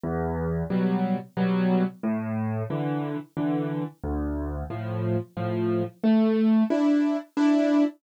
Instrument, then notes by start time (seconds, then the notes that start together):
acoustic grand piano
0.03 E2
0.70 B2 F#3 G3
1.37 B2 F#3 G3
2.03 A2
2.70 D3 E3
3.37 D3 E3
4.03 D2
4.70 A2 F3
5.37 A2 F3
6.03 A3
6.70 D4 E4
7.37 D4 E4